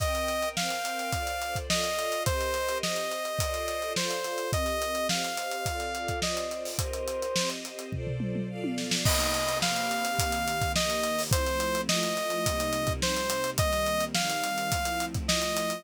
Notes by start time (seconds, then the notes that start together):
0.00 C4 A#4 D#5 G5, kick, closed hi-hat
0.15 closed hi-hat
0.28 closed hi-hat
0.42 closed hi-hat
0.57 C4 A#4 C5 F5 G5, snare
0.70 snare, closed hi-hat
0.85 closed hi-hat
0.99 closed hi-hat
1.13 F4 A4 C5 D5, kick, closed hi-hat
1.27 closed hi-hat
1.42 closed hi-hat
1.55 kick, closed hi-hat
1.70 F4 A4 D5 D#5 F5, snare
1.84 closed hi-hat
1.99 closed hi-hat
2.12 closed hi-hat
2.26 C4 G4 A#4 C5 D#5, kick, closed hi-hat
2.41 closed hi-hat
2.54 snare, closed hi-hat
2.69 closed hi-hat
2.83 C4 G4 C5 D#5, snare
2.96 closed hi-hat
3.11 closed hi-hat
3.25 closed hi-hat
3.39 F4 A4 C5 D5, kick, closed hi-hat
3.54 closed hi-hat
3.68 closed hi-hat
3.82 closed hi-hat
3.96 F4 A4 C5 D5 F5, snare
4.10 closed hi-hat
4.24 snare, closed hi-hat
4.38 closed hi-hat
4.53 C4 G4 A#4 D#5, kick, closed hi-hat
4.66 snare, closed hi-hat
4.82 closed hi-hat
4.95 closed hi-hat
5.09 C4 G4 C5 D#5 F5, snare
5.24 closed hi-hat
5.37 closed hi-hat
5.51 closed hi-hat
5.66 C4 F4 A4 D5, kick, closed hi-hat
5.80 closed hi-hat
5.95 closed hi-hat
6.08 kick, closed hi-hat
6.22 C4 F4 C5 D5 D#5, snare
6.37 closed hi-hat
6.51 closed hi-hat
6.65 open hi-hat
6.79 C4 G4 A#4 C5 D#5, kick, closed hi-hat
6.93 closed hi-hat
7.08 closed hi-hat
7.22 closed hi-hat
7.36 C4 G4 C5 D#5, snare
7.50 closed hi-hat
7.65 closed hi-hat
7.79 closed hi-hat
7.92 F4 A4 C5 D5, kick, floor tom
8.07 floor tom
8.20 mid tom
8.35 mid tom
8.49 F4 A4 D5 F5
8.64 high tom
8.78 snare
8.91 snare
9.05 C3 A#3 D#4 G4 D#5, kick, crash
9.19 snare, closed hi-hat
9.34 closed hi-hat
9.49 closed hi-hat
9.62 C3 A#3 C4 G4 F5, snare
9.76 closed hi-hat
9.91 closed hi-hat
10.05 closed hi-hat
10.19 D#3 A#3 C4 G4, kick, closed hi-hat
10.32 closed hi-hat
10.48 closed hi-hat
10.61 kick, closed hi-hat
10.75 D#3 A#3 D#4 G4 D#5, snare
10.90 closed hi-hat
11.03 closed hi-hat
11.19 open hi-hat
11.31 F3 A3 C4 E4 C5, kick, closed hi-hat
11.46 snare, closed hi-hat
11.60 closed hi-hat
11.75 closed hi-hat
11.89 F3 A3 E4 F4 D#5, snare
12.03 closed hi-hat
12.17 closed hi-hat
12.30 closed hi-hat
12.45 C3 G3 A#3 D#4, kick, closed hi-hat
12.60 closed hi-hat
12.73 closed hi-hat
12.87 kick, closed hi-hat
13.02 C3 G3 C4 D#4 C5, snare
13.17 closed hi-hat
13.30 closed hi-hat
13.44 closed hi-hat
13.58 D#3 G3 A#3 C4 D#5, kick, closed hi-hat
13.72 snare, closed hi-hat
13.86 closed hi-hat
14.00 closed hi-hat
14.15 D#3 G3 C4 D#4 F5, snare
14.30 closed hi-hat
14.44 closed hi-hat
14.58 closed hi-hat
14.72 F3 A3 C4 E4, kick, closed hi-hat
14.85 closed hi-hat
15.00 closed hi-hat
15.14 kick, closed hi-hat
15.28 F3 A3 E4 F4 D#5, snare
15.42 closed hi-hat
15.57 closed hi-hat
15.70 closed hi-hat